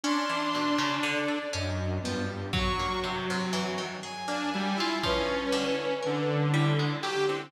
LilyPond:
<<
  \new Staff \with { instrumentName = "Lead 2 (sawtooth)" } { \time 5/8 \tempo 4 = 60 d'4. fis,8 g,8 | fis4. r16 d'16 g16 e'16 | cis'4 d4 g'16 c'16 | }
  \new Staff \with { instrumentName = "Harpsichord" } { \time 5/8 cis'16 e16 b,16 cis16 d16 a'16 cis'8 f8 | fis16 ais16 c16 c16 e16 dis16 gis'16 ais16 e'16 f'16 | f8 d8 ais'8 g16 gis16 fis16 d16 | }
  \new Staff \with { instrumentName = "Violin" } { \time 5/8 c'''4 d''8 dis''8 b16 r16 | cis'''8 r4 gis''4 | b'4. e'16 r8 e'16 | }
  \new DrumStaff \with { instrumentName = "Drums" } \drummode { \time 5/8 r8 hh4 r4 | bd4. r4 | bd4. r4 | }
>>